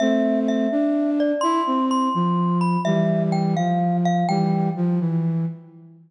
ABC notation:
X:1
M:6/8
L:1/8
Q:3/8=84
K:C
V:1 name="Glockenspiel"
e2 e3 d | c'2 c'3 b | e2 g f2 f | g2 z4 |]
V:2 name="Flute"
[A,C]3 D3 | E C2 F,3 | [E,G,]3 F,3 | [E,G,]2 F, E,2 z |]